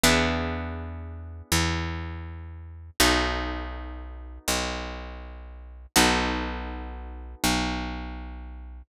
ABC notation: X:1
M:4/4
L:1/8
Q:"Swing" 1/4=81
K:B
V:1 name="Acoustic Guitar (steel)"
[B,=DEG]8 | [B,DF=A]8 | [B,DF=A]8 |]
V:2 name="Electric Bass (finger)" clef=bass
E,,4 E,,4 | B,,,4 B,,,4 | B,,,4 B,,,4 |]